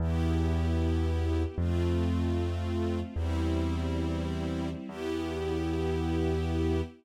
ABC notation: X:1
M:2/4
L:1/8
Q:1/4=76
K:Em
V:1 name="String Ensemble 1"
[B,EG]4 | [A,C=F]4 | "^rit." [G,CE]4 | [B,EG]4 |]
V:2 name="Acoustic Grand Piano" clef=bass
E,,4 | =F,,4 | "^rit." E,,4 | E,,4 |]
V:3 name="String Ensemble 1"
[B,EG]4 | [A,C=F]4 | "^rit." [G,CE]4 | [B,EG]4 |]